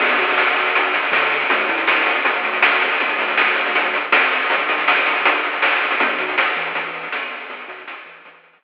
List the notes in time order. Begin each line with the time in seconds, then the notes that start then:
0.00 E2, kick, crash
0.09 closed hi-hat
0.18 B2, kick, closed hi-hat
0.28 closed hi-hat
0.38 snare
0.47 closed hi-hat
0.56 closed hi-hat
0.66 closed hi-hat
0.75 kick, closed hi-hat
0.85 closed hi-hat
0.94 closed hi-hat
1.03 closed hi-hat
1.12 D3, snare
1.22 closed hi-hat
1.31 closed hi-hat
1.41 closed hi-hat
1.50 D2, kick, closed hi-hat
1.59 closed hi-hat
1.69 A2, closed hi-hat
1.78 closed hi-hat
1.87 snare
1.97 kick, closed hi-hat
2.06 closed hi-hat
2.15 kick, closed hi-hat
2.25 G1, kick, closed hi-hat
2.34 closed hi-hat
2.43 D2, closed hi-hat
2.53 closed hi-hat
2.62 snare
2.72 closed hi-hat
2.81 closed hi-hat
2.91 open hi-hat
3.00 G1, kick, closed hi-hat
3.09 closed hi-hat
3.18 D2, closed hi-hat
3.29 closed hi-hat
3.38 snare
3.47 closed hi-hat
3.56 closed hi-hat
3.65 kick, closed hi-hat
3.75 kick, closed hi-hat
3.84 closed hi-hat
3.94 closed hi-hat
4.12 F2, snare
4.22 closed hi-hat
4.31 closed hi-hat
4.41 closed hi-hat
4.50 kick, closed hi-hat
4.59 closed hi-hat
4.69 kick, closed hi-hat
4.78 closed hi-hat
4.88 snare
4.97 kick, closed hi-hat
5.06 closed hi-hat
5.16 kick, closed hi-hat
5.25 kick, closed hi-hat
5.34 closed hi-hat
5.44 closed hi-hat
5.53 closed hi-hat
5.62 snare
5.72 closed hi-hat
5.82 closed hi-hat
5.91 closed hi-hat
6.00 E2, kick, closed hi-hat
6.09 closed hi-hat
6.18 B2, kick, closed hi-hat
6.28 closed hi-hat
6.38 A2, snare
6.47 closed hi-hat
6.56 E3, closed hi-hat
6.65 closed hi-hat
6.75 E3, kick, closed hi-hat
6.85 closed hi-hat
6.94 closed hi-hat
7.03 closed hi-hat
7.12 E2, snare
7.22 closed hi-hat
7.32 closed hi-hat
7.40 open hi-hat
7.49 E2, kick, closed hi-hat
7.59 closed hi-hat
7.68 B2, closed hi-hat
7.79 closed hi-hat
7.88 A2, snare
7.97 kick
8.06 E3, closed hi-hat
8.16 kick, closed hi-hat
8.25 E3, kick, closed hi-hat
8.34 closed hi-hat
8.44 closed hi-hat
8.53 closed hi-hat
8.62 E2, snare